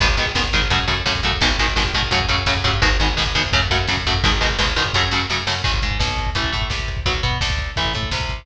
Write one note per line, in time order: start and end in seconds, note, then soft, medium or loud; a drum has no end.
0.00 0.16 G#1 loud
0.00 0.07 D#3 medium
0.00 0.07 G#3 loud
0.00 0.07 B3 medium
0.00 kick loud
0.00 crash medium
0.09 kick medium
0.17 0.32 G#1 medium
0.17 0.25 D#3 medium
0.17 0.25 G#3 medium
0.17 0.25 B3 medium
0.17 kick medium
0.17 closed hi-hat medium
0.26 kick medium
0.35 0.50 G#1 medium
0.35 0.43 D#3 medium
0.35 0.43 G#3 medium
0.35 0.43 B3 medium
0.35 kick medium
0.35 snare loud
0.44 kick medium
0.53 0.68 G#1 medium
0.53 0.61 D#3 medium
0.53 0.61 G#3 medium
0.53 0.61 B3 medium
0.53 kick medium
0.53 closed hi-hat medium
0.62 kick medium
0.70 0.85 F#2 loud
0.70 0.78 C#3 loud
0.70 0.78 F#3 medium
0.70 0.78 A3 medium
0.70 kick medium
0.70 closed hi-hat medium
0.80 kick medium
0.88 1.03 F#2 medium
0.88 0.95 C#3 medium
0.88 0.95 F#3 medium
0.88 0.95 A3 medium
0.88 kick medium
0.88 closed hi-hat medium
0.97 kick medium
1.06 1.21 F#2 medium
1.06 1.13 C#3 medium
1.06 1.13 F#3 medium
1.06 1.13 A3 medium
1.06 kick medium
1.06 snare medium
1.15 kick medium
1.23 1.38 F#2 medium
1.23 1.32 C#3 medium
1.23 1.32 F#3 medium
1.23 1.32 A3 medium
1.23 kick medium
1.23 closed hi-hat medium
1.32 kick medium
1.41 1.56 G#1 loud
1.41 1.49 B2 loud
1.41 1.49 D#3 medium
1.41 1.49 G#3 medium
1.41 kick medium
1.41 closed hi-hat medium
1.50 kick medium
1.58 1.74 G#1 medium
1.58 1.66 B2 medium
1.58 1.66 D#3 medium
1.58 1.66 G#3 medium
1.58 kick medium
1.58 closed hi-hat medium
1.68 kick medium
1.76 1.92 G#1 medium
1.76 1.83 B2 medium
1.76 1.83 D#3 medium
1.76 1.83 G#3 medium
1.76 kick medium
1.76 snare medium
1.85 kick medium
1.94 2.09 G#1 medium
1.94 2.02 B2 medium
1.94 2.02 D#3 medium
1.94 2.02 G#3 medium
1.94 kick medium
1.94 closed hi-hat medium
2.03 kick medium
2.11 2.26 F#2 loud
2.11 2.19 C#3 medium
2.11 2.19 F#3 loud
2.11 2.19 A3 loud
2.11 kick medium
2.11 closed hi-hat medium
2.20 kick medium
2.29 2.44 F#2 medium
2.29 2.36 C#3 medium
2.29 2.36 F#3 medium
2.29 2.36 A3 medium
2.29 kick medium
2.29 closed hi-hat medium
2.37 kick medium
2.46 2.63 F#2 medium
2.46 2.54 C#3 medium
2.46 2.54 F#3 medium
2.46 2.54 A3 medium
2.46 kick medium
2.46 snare loud
2.57 kick medium
2.64 2.80 G2 loud
2.64 2.71 C#3 medium
2.64 2.71 F#3 medium
2.64 2.71 A3 medium
2.64 kick medium
2.64 closed hi-hat medium
2.74 kick medium
2.82 2.97 G#1 loud
2.82 2.89 B2 loud
2.82 2.89 D#3 loud
2.82 2.89 G#3 medium
2.82 kick loud
2.82 closed hi-hat medium
2.92 kick medium
3.00 3.15 G#1 medium
3.00 3.08 B2 medium
3.00 3.08 D#3 medium
3.00 3.08 G#3 medium
3.00 kick medium
3.00 closed hi-hat medium
3.08 kick medium
3.17 3.34 G#1 medium
3.17 3.24 B2 medium
3.17 3.24 D#3 medium
3.17 3.24 G#3 medium
3.17 kick medium
3.17 snare medium
3.26 kick medium
3.35 3.50 G#1 medium
3.35 3.42 B2 medium
3.35 3.42 D#3 medium
3.35 3.42 G#3 medium
3.35 kick medium
3.35 closed hi-hat medium
3.44 kick medium
3.52 3.69 F#2 loud
3.52 3.60 C#3 loud
3.52 3.60 F#3 medium
3.52 3.60 A3 medium
3.52 kick medium
3.52 closed hi-hat medium
3.62 kick medium
3.70 3.86 F#2 medium
3.70 3.78 C#3 medium
3.70 3.78 F#3 medium
3.70 3.78 A3 medium
3.70 kick medium
3.70 closed hi-hat medium
3.79 kick medium
3.87 4.04 F#2 medium
3.87 3.96 C#3 medium
3.87 3.96 F#3 medium
3.87 3.96 A3 medium
3.87 kick medium
3.87 snare medium
3.97 kick medium
4.06 4.22 F#2 medium
4.06 4.14 C#3 medium
4.06 4.14 F#3 medium
4.06 4.14 A3 medium
4.06 kick medium
4.06 closed hi-hat medium
4.14 kick medium
4.24 4.40 G#1 loud
4.24 4.31 B2 medium
4.24 4.31 D#3 loud
4.24 4.31 G#3 loud
4.24 kick loud
4.24 closed hi-hat medium
4.32 kick medium
4.41 4.57 G#1 medium
4.41 4.48 B2 medium
4.41 4.48 D#3 medium
4.41 4.48 G#3 medium
4.41 kick medium
4.41 closed hi-hat medium
4.50 kick medium
4.58 4.74 G#1 medium
4.58 4.66 B2 medium
4.58 4.66 D#3 medium
4.58 4.66 G#3 medium
4.58 kick medium
4.58 snare loud
4.68 kick medium
4.76 4.91 G#1 medium
4.76 4.83 B2 medium
4.76 4.83 D#3 medium
4.76 4.83 G#3 medium
4.76 kick medium
4.76 closed hi-hat medium
4.86 kick medium
4.93 5.09 F#2 loud
4.93 5.02 C#3 loud
4.93 5.02 F#3 medium
4.93 5.02 A3 loud
4.93 kick medium
4.93 snare medium
5.11 5.26 F#2 medium
5.11 5.20 C#3 medium
5.11 5.20 F#3 medium
5.11 5.20 A3 medium
5.11 snare medium
5.30 5.45 F#2 medium
5.30 5.38 C#3 medium
5.30 5.38 F#3 medium
5.30 5.38 A3 medium
5.30 snare medium
5.47 5.62 F#2 medium
5.47 5.54 C#3 medium
5.47 5.54 F#3 medium
5.47 5.54 A3 medium
5.47 snare loud
5.64 5.80 G#1 medium
5.64 5.71 D#3 medium
5.64 5.71 G#3 medium
5.64 kick medium
5.64 crash medium
5.74 kick medium
5.82 5.98 G#2 medium
5.82 5.98 G#3 medium
5.82 kick medium
5.82 closed hi-hat medium
5.91 kick medium
5.99 6.30 B1 medium
5.99 6.29 B2 medium
5.99 kick medium
5.99 snare loud
6.08 kick medium
6.18 kick medium
6.18 closed hi-hat medium
6.27 kick medium
6.35 6.51 A1 medium
6.35 6.51 E3 medium
6.35 6.51 A3 medium
6.35 kick medium
6.35 closed hi-hat medium
6.44 kick medium
6.52 6.69 A2 medium
6.52 6.67 A3 medium
6.52 kick medium
6.52 closed hi-hat medium
6.62 kick medium
6.70 7.00 C2 medium
6.70 7.00 C3 medium
6.70 kick medium
6.70 snare medium
6.80 kick medium
6.88 kick medium
6.88 closed hi-hat medium
6.97 kick medium
7.06 7.21 B1 medium
7.06 7.13 F#3 medium
7.06 7.13 B3 medium
7.06 kick medium
7.06 closed hi-hat medium
7.15 kick medium
7.23 7.38 B2 medium
7.23 7.38 B3 medium
7.23 kick medium
7.23 closed hi-hat medium
7.32 kick medium
7.41 7.71 D2 medium
7.41 7.71 D3 medium
7.41 kick medium
7.41 snare loud
7.50 kick medium
7.59 kick medium
7.59 closed hi-hat medium
7.76 7.93 A1 medium
7.76 7.93 E3 medium
7.76 7.93 A3 medium
7.76 kick medium
7.76 closed hi-hat medium
7.85 kick medium
7.94 8.10 A2 medium
7.94 8.10 A3 medium
7.94 kick medium
7.94 closed hi-hat medium
8.03 kick medium
8.11 8.42 C2 medium
8.11 8.42 C3 medium
8.11 kick medium
8.11 snare loud
8.20 kick medium
8.29 kick medium
8.29 closed hi-hat medium
8.39 kick medium